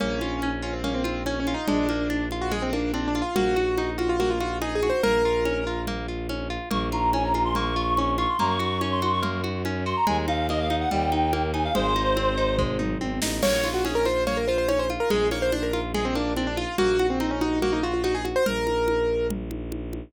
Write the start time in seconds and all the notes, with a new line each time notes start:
0.00 A#1 A#3 C#4, low conga
0.21 F4, high conga
0.42 C#4, high conga
0.62 C#4 F4
0.73 C4
0.84 A#3 C#4, low conga
0.94 C4
1.04 C4 F4, high conga
1.26 C#4, high conga
1.40 C#4
1.47 F4, high conga
1.54 D#4
1.68 A#1 G#3 D4, low conga
1.89 A#3, high conga
2.10 D4, high conga
2.31 F4, high conga
2.41 F#4
2.51 G#3 G#4, low conga
2.62 C4
2.73 A#3 D4, high conga
2.94 C4 D4, high conga
3.08 D4
3.15 F4, high conga
3.22 F4
3.35 A#1 A#3 F#4, low conga
3.56 F#4, high conga
3.78 D#4, high conga
3.98 F4 F#4, high conga
4.09 F4
4.20 A#3 F#4, low conga
4.30 F4
4.40 F4 F#4, high conga
4.61 D#4 G#4, high conga
4.75 G#4
4.83 F#4, high conga
4.90 C5
5.03 A#1 A#3 A#4, low conga
5.25 F4
5.45 C#4, high conga
5.67 F4
5.87 A#3, low conga
6.08 F4
6.29 C#4, high conga
6.50 F4
6.70 A#1 A#3 C#6, low conga
6.92 F4 A#5, high conga
7.13 C#4 G#5, high conga
7.24 A#5
7.34 F4, high conga
7.45 C6
7.55 A#3 C#6, low conga
7.76 F4
7.97 C#4, high conga
8.18 F4 C#6, high conga
8.28 C6
8.39 F#2 A#3 A#5, low conga
8.50 C#6
8.59 F#4 C#6, high conga
8.81 C#4 C#6, high conga
8.92 C6
9.02 F#4, high conga
9.13 C#6
9.22 A#3, low conga
9.43 F#4, high conga
9.65 C#4, high conga
9.86 F#4 C6
9.96 A#5
10.07 D#2 G#3 G#5, low conga
10.28 D#4 F5, high conga
10.49 A#3 D#5, high conga
10.60 F5
10.70 D#4, high conga
10.80 F#5
10.91 D#2 G3 G5, low conga
11.12 D#4, high conga
11.33 A#3, high conga
11.53 D#4 G#5, high conga
11.64 F5
11.75 G#1 G#3 C5, low conga
11.96 D#4, high conga
12.16 C4, high conga
12.37 D#4
12.58 G#3, kick, floor tom
12.79 D#4, mid tom
13.00 G#1 C4, high tom
13.22 A1 D#4, snare
13.42 A#1 A#3 C#5, crash, low conga
13.64 F4, high conga
13.74 F#4
13.85 C#4 G#4, high conga
13.95 A#4
14.05 F4 C5, high conga
14.27 A#3 C#5, low conga
14.37 A#4
14.48 F4 C5
14.58 C5
14.68 C#4 C#5, high conga
14.79 C5
14.90 F4, high conga
15.00 A#4
15.10 A#1 G#3 G#4, low conga
15.31 A#3 C#5, high conga
15.42 C5
15.52 D4 C5, high conga
15.63 A#4
15.73 F4, high conga
15.94 G#3 G#4, low conga
16.05 C4
16.15 A#3 D4, high conga
16.37 C4 D4, high conga
16.47 D4
16.57 F4, high conga
16.78 A#1 A#3 F#4, low conga
16.99 F#4, high conga
17.10 C4
17.20 C4 D#4, high conga
17.31 C#4
17.41 D#4 F#4, high conga
17.62 A#3 F#4, low conga
17.73 D#4
17.83 F4 F#4
17.94 F4
18.04 D#4 F#4, high conga
18.15 G#4
18.25 F#4, high conga
18.36 C5
18.46 A#1 A#4, low conga
18.67 high conga
18.88 high conga
19.30 low conga
19.51 high conga
19.72 high conga
19.93 high conga